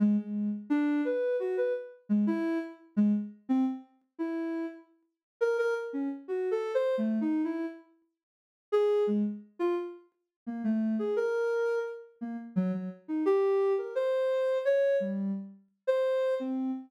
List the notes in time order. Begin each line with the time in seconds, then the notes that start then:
0.00 G#3
0.18 G#3
0.70 D4
1.05 B4
1.40 F#4
1.57 B4
2.09 G#3
2.27 E4
2.97 G#3
3.49 C4
4.19 E4
5.41 A#4
5.58 A#4
5.93 C#4
6.28 F#4
6.51 A4
6.75 C5
6.98 A3
7.21 D#4
7.44 E4
8.72 G#4
9.07 G#3
9.59 F4
10.47 A#3
10.64 A3
10.99 G#4
11.16 A#4
12.21 A#3
12.56 F#3
12.73 F#3
13.08 D#4
13.26 G4
13.78 A#4
13.95 C5
14.65 C#5
15.00 G3
15.87 C5
16.40 C4